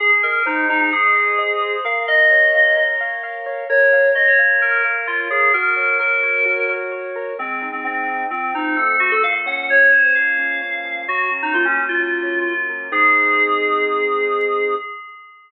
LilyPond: <<
  \new Staff \with { instrumentName = "Electric Piano 2" } { \time 4/4 \key aes \mixolydian \tempo 4 = 130 aes'16 r16 bes'8 ees'8 ees'16 ees'16 aes'2 | f''8 ees''2 r4. | des''4 ees''16 des''16 r8 bes'8 r8 f'8 aes'8 | bes'4 bes'2 r4 |
c'8. c'16 c'4 c'8 ees'8 a'8 ges'16 a'16 | f''16 r16 ges''8 des''8 c''16 c''16 f''2 | ges'8 r16 ees'16 f'16 des'8 f'4.~ f'16 r8 | aes'1 | }
  \new Staff \with { instrumentName = "Acoustic Grand Piano" } { \time 4/4 \key aes \mixolydian aes'8 ees''8 c''8 ees''8 aes'8 ees''8 ees''8 c''8 | bes'8 f''8 des''8 f''8 bes'8 f''8 f''8 des''8 | bes'8 f''8 des''8 f''8 bes'8 f''8 f''8 des''8 | ges'8 des''8 bes'8 des''8 ges'8 des''8 des''8 bes'8 |
aes8 ees'8 c'8 ees'8 f8 c'8 a8 c'8 | bes,8 des'8 f8 des'8 bes,8 des'8 des'8 f8 | ges8 des'8 bes8 des'8 ges8 des'8 des'8 bes8 | <aes c' ees'>1 | }
>>